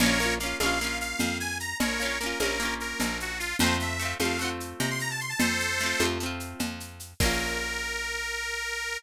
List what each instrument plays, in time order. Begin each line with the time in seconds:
0.00 electric bass (finger) A#1, acoustic guitar (steel) A#3 C#4, accordion A#4 C#5, cowbell, low conga, shaker
0.06 acoustic guitar (steel) F4
0.20 acoustic guitar (steel) A#3 C#4, shaker
0.26 acoustic guitar (steel) F4
0.40 acoustic guitar (steel) A#3 C#4, accordion F5, shaker
0.46 acoustic guitar (steel) F4
0.60 electric bass (finger) A#1, acoustic guitar (steel) A#3 C#4, accordion F5, cowbell, high conga, shaker
0.66 acoustic guitar (steel) F4
0.81 acoustic guitar (steel) A#3 C#4, shaker
0.87 acoustic guitar (steel) F4
1.00 accordion F5, shaker
1.19 electric bass (finger) F2, cowbell, low conga, shaker
1.40 accordion G#5, shaker
1.60 accordion A#5, shaker
1.80 electric bass (finger) A#1, accordion A#4 C#5, cowbell, low conga, shaker
2.00 acoustic guitar (steel) A#3 C#4, shaker
2.05 acoustic guitar (steel) F4
2.20 acoustic guitar (steel) A#3 C#4, accordion A#4, shaker
2.26 acoustic guitar (steel) F4
2.40 electric bass (finger) A#1, acoustic guitar (steel) A#3 C#4, accordion A#4, cowbell, high conga, shaker
2.45 acoustic guitar (steel) F4
2.60 acoustic guitar (steel) A#3 C#4, shaker
2.65 acoustic guitar (steel) F4
2.80 accordion A#4, shaker
3.00 electric bass (finger) A#1, cowbell, low conga, shaker
3.20 accordion F#4, shaker
3.39 accordion F4, shaker
3.59 electric bass (finger) F2, acoustic guitar (steel) A3, accordion C5, cowbell, low conga, shaker
3.64 acoustic guitar (steel) C4 F4
3.80 accordion E5, shaker
3.99 acoustic guitar (steel) A3 C4, shaker
4.05 acoustic guitar (steel) F4
4.20 electric bass (finger) F2, acoustic guitar (steel) A3 C4, accordion F5, cowbell, high conga, shaker
4.25 acoustic guitar (steel) F4
4.39 acoustic guitar (steel) A3 C4, accordion F#5, shaker
4.45 acoustic guitar (steel) F4
4.60 shaker
4.80 electric bass (finger) C3, accordion A#5, cowbell, low conga, shaker
4.90 accordion C6
4.99 accordion A#5, shaker
5.10 accordion A5
5.20 accordion C6, shaker
5.29 accordion A5
5.39 electric bass (finger) F2, accordion A4 C5, cowbell, low conga, shaker
5.60 shaker
5.79 acoustic guitar (steel) A3, shaker
5.83 acoustic guitar (steel) C4 F4
6.00 electric bass (finger) F2, acoustic guitar (steel) A3 C4, cowbell, high conga, shaker
6.05 acoustic guitar (steel) F4
6.20 acoustic guitar (steel) A3 C4, shaker
6.26 acoustic guitar (steel) F4
6.40 shaker
6.59 electric bass (finger) F2, cowbell, low conga, shaker
6.80 shaker
7.00 shaker
7.20 electric bass (finger) A#1, acoustic guitar (steel) A#3 C#4, accordion A#4, kick, crash
7.26 acoustic guitar (steel) F4